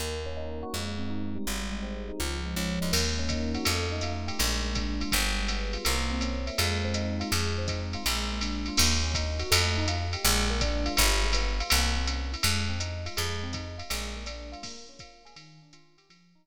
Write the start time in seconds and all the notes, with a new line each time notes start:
0.00 D#2 A#3
0.26 C#4
0.37 D#4
0.63 F#4
0.73 F2 G#3
0.98 C4
1.10 D#4
1.35 G3
1.47 G#1
1.72 G#3
1.83 C4
2.08 D#4
2.20 C#2 F3
2.46 G#3
2.56 C#2 C#4
2.81 D2 D#4
2.92 D#2 A#3, crash, ride
3.19 C#4
3.29 D#4, kick, hi-hat pedal, ride
3.54 F#4, ride
3.65 F2 A3, ride
3.92 D#4
4.01 F4, hi-hat pedal, ride
4.27 G4, ride
4.39 A#1 G#3, ride
4.63 A#3
4.75 D4, kick, hi-hat pedal, ride
5.00 F4, ride
5.12 G1 G3, kick, ride
5.38 G#3
5.48 B3, hi-hat pedal, ride
5.73 F4, ride
5.85 C2 A#3, ride
6.11 C4
6.21 C#4, hi-hat pedal, ride
6.47 E4, ride
6.58 F2 G#3, ride
6.84 C4
6.94 D#4, hi-hat pedal, ride
7.20 F4, ride
7.31 F2 G#3, ride
7.58 C4
7.67 D#4, kick, hi-hat pedal, ride
7.93 F4, ride
8.04 A#1 G#3, ride
8.31 A#3
8.41 D4, hi-hat pedal, ride
8.66 F4, ride
8.77 D#2 A#3, crash, ride
9.03 C#4
9.14 D#4, kick, hi-hat pedal, ride
9.39 F#4, ride
9.51 F2 A3, ride
9.77 D#4
9.88 F4, hi-hat pedal, ride
10.13 G4, ride
10.24 A#1 G#3, ride
10.50 A#3
10.61 D4, kick, hi-hat pedal, ride
10.86 F4, ride
10.97 G1 G3, kick, ride
11.24 G#3
11.33 B3, hi-hat pedal, ride
11.60 F4, ride
11.70 C2 A#3, ride
11.96 C4
12.07 C#4, hi-hat pedal, ride
12.32 E4, ride
12.43 F2 G#3, ride
12.69 C4
12.80 D#4, hi-hat pedal, ride
13.06 F4, ride
13.17 F2 G#3, ride
13.43 C4
13.53 D#4, kick, hi-hat pedal, ride
13.78 F4, ride
13.90 A#1 G#3, ride
14.15 A#3
14.26 D4, hi-hat pedal, ride
14.52 F4, ride
14.63 A#3, kick, crash, ride
14.89 C#4
14.99 F4, kick, hi-hat pedal, ride
15.25 G#4, ride
15.36 D#3, ride
15.62 D4
15.73 F4, hi-hat pedal, ride
15.98 G4, ride
16.10 F3, ride
16.35 D#4
16.45 F#4, ride